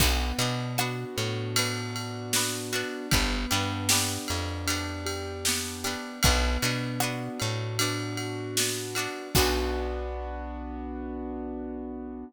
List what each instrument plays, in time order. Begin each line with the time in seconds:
0.00 electric bass (finger) B1, acoustic grand piano B3, pizzicato strings B3 D4 F#4, kick, crash
0.38 electric bass (finger) B2, pizzicato strings B3 D4 F#4, acoustic grand piano D4, ride
0.78 pizzicato strings B3 D4 F#4, acoustic grand piano F#4, cross-stick
1.16 electric bass (finger) A2, acoustic grand piano B3, ride
1.56 pizzicato strings B3 D4 F#4, acoustic grand piano D4, ride
1.95 acoustic grand piano F#4, ride
2.33 acoustic grand piano B3, pizzicato strings B3 D4 F#4, snare
2.73 pizzicato strings B3 D4 F#4, acoustic grand piano D4, ride
3.11 electric bass (finger) G1, acoustic grand piano B3, pizzicato strings B3 D4 G4, kick, ride
3.51 electric bass (finger) G2, pizzicato strings B3 D4 G4, acoustic grand piano D4, ride
3.89 pizzicato strings B3 D4 G4, acoustic grand piano G4, snare
4.28 electric bass (finger) F2, acoustic grand piano B3, ride
4.67 pizzicato strings B3 D4 G4, acoustic grand piano D4, ride
5.06 acoustic grand piano G4, ride
5.45 acoustic grand piano B3, pizzicato strings B3 D4 G4, snare
5.84 pizzicato strings B3 D4 G4, acoustic grand piano D4, ride
6.23 electric bass (finger) B1, acoustic grand piano B3, pizzicato strings B3 D4 F#4, kick, ride
6.62 electric bass (finger) B2, pizzicato strings B3 D4 F#4, acoustic grand piano D4, ride
7.00 pizzicato strings B3 D4 F#4, acoustic grand piano F#4, cross-stick
7.39 electric bass (finger) A2, acoustic grand piano B3, ride
7.79 pizzicato strings B3 D4 F#4, acoustic grand piano D4, ride
8.17 acoustic grand piano F#4, ride
8.56 acoustic grand piano B3, pizzicato strings D4 F#4, snare
8.60 pizzicato strings B3
8.95 pizzicato strings B3 D4 F#4, acoustic grand piano D4, ride
9.35 electric bass (finger) B1, acoustic grand piano B3 D4 F#4, pizzicato strings B3 D4 F#4, kick, crash